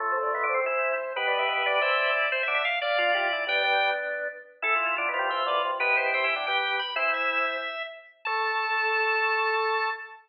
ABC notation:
X:1
M:7/8
L:1/8
Q:1/4=181
K:Am
V:1 name="Drawbar Organ"
(3A c d e c4 | (3B d e e d4 | (3c e e f d4 | g3 z4 |
(3A F F F F4 | B c g2 g2 b | "^rit." c e4 z2 | a7 |]
V:2 name="Drawbar Organ"
[F,A,]4 [CE]2 z | [GB]4 [ce]2 z | z3 [df] [DF] [EG] z | [B,D] [B,D]4 z2 |
z3 [CE] [ce] [Bd] z | [EG]4 [G,B,]2 z | "^rit." [CE]4 z3 | A7 |]
V:3 name="Drawbar Organ"
[A,,A,] [A,,A,] (3[B,,B,] [D,D] [C,C] [E,E]2 z | [B,,B,]2 [B,,B,] [D,D] [E,E]3 | z [D,D] z2 [F,F] [F,F] [E,E] | [G,,G,]3 z4 |
[E,E]2 (3[D,D] [B,,B,] [G,,G,] [E,,E,] [D,,D,] [C,,C,] | [B,,B,] [B,,B,] (3[C,C] [E,E] [D,D] [G,G]2 z | "^rit." [E,E]3 z4 | A,7 |]